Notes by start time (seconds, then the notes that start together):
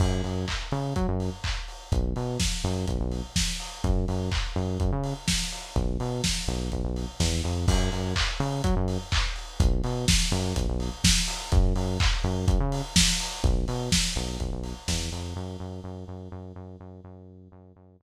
0.00 F#2, kick, crash
0.24 F#2, open hi-hat
0.48 kick, clap
0.71 C#3, open hi-hat
0.96 F#3, kick, closed hi-hat
1.08 F#2
1.20 open hi-hat
1.44 kick, clap
1.68 open hi-hat
1.92 B1, kick, closed hi-hat
2.16 B2, open hi-hat
2.40 kick, snare
2.64 F#2, open hi-hat
2.88 B1, kick, closed hi-hat
3.00 B1
3.12 open hi-hat
3.36 kick, snare
3.60 open hi-hat
3.84 F#2, kick, closed hi-hat
4.08 F#2, open hi-hat
4.32 kick, clap
4.56 F#2, open hi-hat
4.80 F#2, kick, closed hi-hat
4.92 C#3
5.04 open hi-hat
5.28 kick, snare
5.52 open hi-hat
5.76 B1, kick, closed hi-hat
6.00 B2, open hi-hat
6.24 kick, snare
6.48 B1, open hi-hat
6.72 B1, kick, closed hi-hat
6.84 B1
6.96 open hi-hat
7.20 E2, kick, snare
7.44 F2, open hi-hat
7.68 F#2, kick, crash
7.92 F#2, open hi-hat
8.16 kick, clap
8.40 C#3, open hi-hat
8.64 F#3, kick, closed hi-hat
8.76 F#2
8.88 open hi-hat
9.12 kick, clap
9.36 open hi-hat
9.60 B1, kick, closed hi-hat
9.84 B2, open hi-hat
10.08 kick, snare
10.32 F#2, open hi-hat
10.56 B1, kick, closed hi-hat
10.68 B1
10.80 open hi-hat
11.04 kick, snare
11.28 open hi-hat
11.52 F#2, kick, closed hi-hat
11.76 F#2, open hi-hat
12.00 kick, clap
12.24 F#2, open hi-hat
12.48 F#2, kick, closed hi-hat
12.60 C#3
12.72 open hi-hat
12.96 kick, snare
13.20 open hi-hat
13.44 B1, kick, closed hi-hat
13.68 B2, open hi-hat
13.92 kick, snare
14.16 B1, open hi-hat
14.40 B1, kick, closed hi-hat
14.52 B1
14.63 open hi-hat
14.88 E2, kick, snare
15.12 F2, open hi-hat
15.36 F#2
15.60 F#2
15.84 F#2
16.08 F#2
16.32 F#2
16.56 F#2
16.80 F#2
17.04 F#2
17.52 F#2
17.76 F#2
18.00 F#2